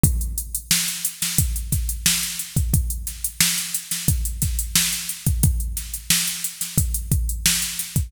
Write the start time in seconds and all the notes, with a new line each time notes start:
0.04 kick, closed hi-hat
0.21 closed hi-hat
0.38 closed hi-hat
0.55 closed hi-hat
0.71 snare
0.88 closed hi-hat
1.05 closed hi-hat
1.22 snare, closed hi-hat
1.38 kick, closed hi-hat
1.56 closed hi-hat
1.72 kick, snare, closed hi-hat
1.89 closed hi-hat
2.06 snare
2.23 closed hi-hat
2.39 closed hi-hat
2.56 kick, closed hi-hat
2.74 kick, closed hi-hat
2.90 closed hi-hat
3.07 snare, closed hi-hat
3.24 closed hi-hat
3.41 snare
3.58 closed hi-hat
3.75 closed hi-hat
3.91 snare, closed hi-hat
4.08 kick, closed hi-hat
4.25 closed hi-hat
4.42 kick, snare, closed hi-hat
4.59 closed hi-hat
4.76 snare
4.93 closed hi-hat
5.09 closed hi-hat
5.26 kick, closed hi-hat
5.43 kick, closed hi-hat
5.60 closed hi-hat
5.77 snare, closed hi-hat
5.94 closed hi-hat
6.10 snare
6.28 closed hi-hat
6.44 closed hi-hat
6.61 snare, closed hi-hat
6.78 kick, closed hi-hat
6.94 closed hi-hat
7.12 kick, closed hi-hat
7.29 closed hi-hat
7.46 snare
7.62 closed hi-hat
7.79 snare, closed hi-hat
7.96 kick, closed hi-hat